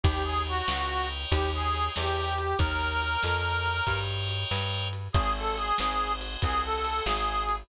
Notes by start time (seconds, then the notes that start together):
0.03 D#2 G4 A#4 C#5 D#5 G5, kick, ride
0.24 G#4
0.47 F#4, ride
0.68 C#2, snare
1.11 ride
1.31 D#2 G4, kick, ride
1.54 G#4
1.74 ride
1.96 E2 G4, snare
2.38 ride
2.59 D#2 A#4 C#5 D#5 G5, kick, ride
3.02 ride
3.23 F2, snare
3.66 ride
3.87 G2, kick, ride
4.29 ride
4.51 G2, snare
4.93 ride
5.13 G#1 G#4 C5 D#5 F#5 G#5, kick, ride
5.37 A4
5.57 G#4, ride
5.78 G#1, snare
6.21 ride
6.42 C2 G#4, kick, ride
6.63 A4
6.85 ride
7.04 G#1 G#4, snare
7.49 ride